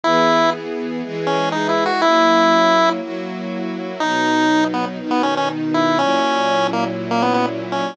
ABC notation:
X:1
M:4/4
L:1/16
Q:1/4=121
K:B
V:1 name="Lead 1 (square)"
E4 z6 C2 (3D2 E2 F2 | E8 z8 | D6 B, z2 B, C C z2 E2 | C6 A, z2 A, B, B, z2 C2 |]
V:2 name="String Ensemble 1"
[E,B,G]8 [E,G,G]8 | [F,A,CE]8 [F,A,EF]8 | [B,,F,D]8 [B,,D,D]8 | [A,,F,CE]16 |]